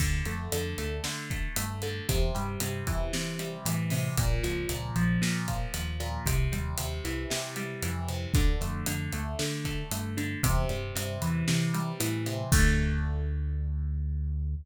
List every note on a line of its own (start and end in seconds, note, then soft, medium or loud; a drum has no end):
0.00 0.22 D2 medium
0.00 0.52 D3 medium
0.00 kick medium
0.00 crash medium
0.25 0.48 F2 medium
0.25 0.78 A3 medium
0.25 closed hi-hat medium
0.52 0.74 F2 medium
0.52 1.04 D3 medium
0.52 closed hi-hat medium
0.78 1.00 D2 medium
0.78 1.30 A3 medium
0.78 closed hi-hat medium
1.04 1.48 D3 medium
1.04 1.82 D3 medium
1.04 snare medium
1.30 1.56 A3 medium
1.30 kick medium
1.30 closed hi-hat medium
1.56 2.01 G2 medium
1.56 2.06 A3 medium
1.56 closed hi-hat loud
1.82 2.07 D3 medium
1.82 closed hi-hat medium
2.09 2.31 E2 medium
2.09 2.61 C3 medium
2.09 kick loud
2.09 closed hi-hat medium
2.35 2.57 G2 medium
2.35 3.39 G3 medium
2.35 closed hi-hat medium
2.60 2.83 G2 medium
2.60 3.13 C3 medium
2.60 closed hi-hat medium
2.87 3.09 E2 medium
2.87 3.65 E3 medium
2.87 kick medium
2.87 closed hi-hat medium
3.13 3.91 C3 medium
3.13 3.57 E3 medium
3.13 snare medium
3.39 4.13 G3 medium
3.39 closed hi-hat medium
3.65 4.09 A2 medium
3.65 4.15 E3 medium
3.65 closed hi-hat medium
3.90 4.16 C3 medium
3.90 open hi-hat medium
4.17 4.40 A#1 medium
4.17 4.69 A#2 medium
4.17 kick medium
4.17 closed hi-hat medium
4.43 4.66 C#2 medium
4.43 4.95 F3 medium
4.43 closed hi-hat medium
4.69 4.91 C#2 medium
4.69 5.21 A#2 medium
4.69 closed hi-hat medium
4.96 5.18 A#1 medium
4.96 5.47 F3 medium
4.96 closed hi-hat medium
5.22 5.66 A#2 medium
5.22 5.99 A#2 medium
5.22 snare medium
5.48 5.73 F3 medium
5.48 kick medium
5.48 closed hi-hat medium
5.74 6.18 D#2 medium
5.74 6.23 F3 medium
5.74 closed hi-hat medium
6.00 6.25 A#2 medium
6.00 closed hi-hat medium
6.26 6.48 C2 medium
6.26 6.78 C3 medium
6.26 kick medium
6.26 closed hi-hat medium
6.52 6.74 D#2 medium
6.52 7.56 G3 medium
6.52 closed hi-hat medium
6.77 7.00 D#2 medium
6.77 7.30 C3 medium
6.77 closed hi-hat medium
7.04 7.26 C2 medium
7.04 7.82 E3 medium
7.04 closed hi-hat medium
7.30 8.08 C3 medium
7.30 7.75 C3 medium
7.30 snare loud
7.56 8.31 G3 medium
7.56 closed hi-hat medium
7.82 8.27 F2 medium
7.82 8.32 E3 medium
7.82 closed hi-hat medium
8.08 8.33 C3 medium
8.08 closed hi-hat medium
8.34 8.57 D2 medium
8.34 8.86 D3 medium
8.34 kick loud
8.34 closed hi-hat medium
8.61 8.83 F2 medium
8.61 9.13 A3 medium
8.61 closed hi-hat medium
8.86 9.09 F2 medium
8.86 9.38 D3 medium
8.86 closed hi-hat medium
9.12 9.35 D2 medium
9.12 9.65 A3 medium
9.12 closed hi-hat medium
9.39 10.17 D3 medium
9.39 9.84 D3 medium
9.39 snare medium
9.65 9.91 A3 medium
9.65 kick medium
9.65 closed hi-hat medium
9.91 10.36 G2 medium
9.91 10.41 A3 medium
9.91 closed hi-hat medium
10.17 10.42 D3 medium
10.17 closed hi-hat medium
10.43 10.66 E2 medium
10.43 10.95 C3 medium
10.43 kick medium
10.43 closed hi-hat loud
10.69 10.92 G2 medium
10.69 11.73 G3 medium
10.69 closed hi-hat medium
10.96 11.18 G2 medium
10.96 11.47 C3 medium
10.96 closed hi-hat medium
11.22 11.44 E2 medium
11.22 11.99 E3 medium
11.22 closed hi-hat medium
11.48 12.26 C3 medium
11.48 11.92 E3 medium
11.48 snare medium
11.74 12.48 G3 medium
11.74 closed hi-hat medium
12.00 12.45 A2 medium
12.00 12.49 E3 medium
12.00 closed hi-hat medium
12.26 12.51 C3 medium
12.26 closed hi-hat medium
12.52 14.55 D2 loud
12.52 14.55 D3 loud
12.52 14.55 A3 loud
12.52 kick loud
12.52 crash loud